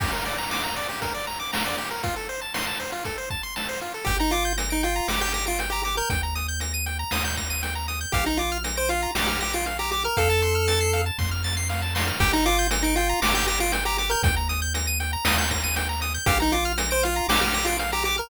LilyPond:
<<
  \new Staff \with { instrumentName = "Lead 1 (square)" } { \time 4/4 \key g \minor \tempo 4 = 118 r1 | r1 | g'16 ees'16 f'8 r16 ees'16 f'8 g'16 g'16 g'16 f'16 r16 g'16 g'16 bes'16 | r1 |
g'16 ees'16 f'8 r16 c''16 f'8 g'16 g'16 g'16 f'16 r16 g'16 g'16 bes'16 | a'2 r2 | g'16 ees'16 f'8 r16 ees'16 f'8 g'16 g'16 g'16 f'16 r16 g'16 g'16 bes'16 | r1 |
g'16 ees'16 f'8 r16 c''16 f'8 g'16 g'16 g'16 f'16 r16 g'16 g'16 bes'16 | }
  \new Staff \with { instrumentName = "Lead 1 (square)" } { \time 4/4 \key g \minor g'16 bes'16 d''16 bes''16 d'''16 bes''16 d''16 g'16 bes'16 d''16 bes''16 d'''16 bes''16 d''16 g'16 bes'16 | f'16 a'16 c''16 a''16 c'''16 a''16 c''16 f'16 a'16 c''16 a''16 c'''16 a''16 c''16 f'16 a'16 | g''16 bes''16 d'''16 g'''16 bes'''16 d''''16 g''16 bes''16 d'''16 g'''16 bes'''16 d''''16 g''16 bes''16 d'''16 g'''16 | g''16 bes''16 ees'''16 g'''16 bes'''16 ees''''16 g''16 bes''16 ees'''16 g'''16 bes'''16 ees''''16 g''16 bes''16 ees'''16 g'''16 |
f''16 bes''16 d'''16 f'''16 bes'''16 d''''16 f''16 bes''16 d'''16 f'''16 bes'''16 d''''16 f''16 bes''16 d'''16 f'''16 | f''16 a''16 c'''16 f'''16 a'''16 c''''16 f''16 a''16 c'''16 f'''16 a'''16 c''''16 f''16 a''16 c'''16 f'''16 | g''16 bes''16 d'''16 g'''16 bes'''16 d''''16 g''16 bes''16 d'''16 g'''16 bes'''16 d''''16 g''16 bes''16 d'''16 g'''16 | g''16 bes''16 ees'''16 g'''16 bes'''16 ees''''16 g''16 bes''16 ees'''16 g'''16 bes'''16 ees''''16 g''16 bes''16 ees'''16 g'''16 |
f''16 bes''16 d'''16 f'''16 bes'''16 d''''16 f''16 bes''16 d'''16 f'''16 bes'''16 d''''16 f''16 bes''16 d'''16 f'''16 | }
  \new Staff \with { instrumentName = "Synth Bass 1" } { \clef bass \time 4/4 \key g \minor r1 | r1 | g,,2 g,,2 | ees,2 ees,2 |
bes,,2 bes,,2 | f,2 f,2 | g,,2 g,,2 | ees,2 ees,2 |
bes,,2 bes,,2 | }
  \new DrumStaff \with { instrumentName = "Drums" } \drummode { \time 4/4 <cymc bd>4 sn4 <hh bd>4 sn4 | <hh bd>4 sn4 <hh bd>8 bd8 sn4 | <hh bd>8 hh8 hh8 hh8 sn8 hh8 hh8 hh8 | <hh bd>8 hh8 hh8 hh8 sn8 <hh bd>8 hh8 hh8 |
<hh bd>8 hh8 hh8 hh8 sn8 hh8 hh8 hh8 | <hh bd>8 hh8 hh8 hh8 <bd sn>8 sn8 sn8 sn8 | <hh bd>8 hh8 hh8 hh8 sn8 hh8 hh8 hh8 | <hh bd>8 hh8 hh8 hh8 sn8 <hh bd>8 hh8 hh8 |
<hh bd>8 hh8 hh8 hh8 sn8 hh8 hh8 hh8 | }
>>